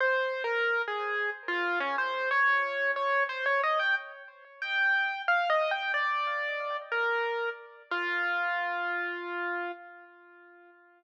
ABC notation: X:1
M:3/4
L:1/16
Q:1/4=91
K:Fm
V:1 name="Acoustic Grand Piano"
(3c4 B4 A4 z F2 D | c2 d4 d2 c d e g | z4 g4 (3f2 e2 g2 | =d6 B4 z2 |
F12 |]